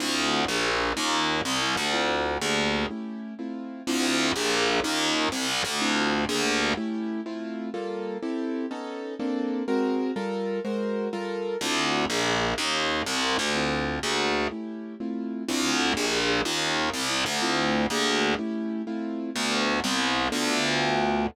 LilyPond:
<<
  \new Staff \with { instrumentName = "Acoustic Grand Piano" } { \time 6/8 \key d \dorian \tempo 4. = 124 <c' d' e' f'>4. <bes d' g' aes'>4. | <des' ees' f' g'>4. c'8 e'8 g'8 | <c' d' e' f'>4. <bes d' g' aes'>4. | <a cis' e' g'>4. <a c' e' f'>4. |
<c' d' e' f'>4. <bes d' g' aes'>4. | <des' ees' f' g'>4. c'8 e'8 g'8 | <c' d' e' f'>4. <bes d' g' aes'>4. | <a cis' e' g'>4. <a c' e' f'>4. |
\key g \dorian <g bes f' a'>4. <c' e' g' a'>4. | <b cis' dis' a'>4. <bes c' d' a'>4. | <aes c' ges' bes'>4. <g f' a' bes'>4. | <aes ges' bes' c''>4. <g f' a' bes'>4. |
\key d \dorian <c' d' e' f'>4. <bes d' g' aes'>4. | <des' ees' f' g'>4. c'8 e'8 g'8 | <c' d' e' f'>4. <bes d' g' aes'>4. | <a cis' e' g'>4. <a c' e' f'>4. |
<c' d' e' f'>4. <bes d' g' aes'>4. | <des' ees' f' g'>4. c'8 e'8 g'8 | <c' d' e' f'>4. <bes d' g' aes'>4. | <a cis' e' g'>4. <a c' e' f'>4. |
<a b d' f'>4. <g b c' e'>4. | <b d' f' a'>2. | }
  \new Staff \with { instrumentName = "Electric Bass (finger)" } { \clef bass \time 6/8 \key d \dorian d,4. bes,,4. | ees,4. c,4 d,8~ | d,4. d,4. | r2. |
d,4. bes,,4. | ees,4. c,4 d,8~ | d,4. d,4. | r2. |
\key g \dorian r2. | r2. | r2. | r2. |
\key d \dorian d,4. bes,,4. | ees,4. c,4 d,8~ | d,4. d,4. | r2. |
d,4. bes,,4. | ees,4. c,4 d,8~ | d,4. d,4. | r2. |
d,4. c,4. | d,2. | }
>>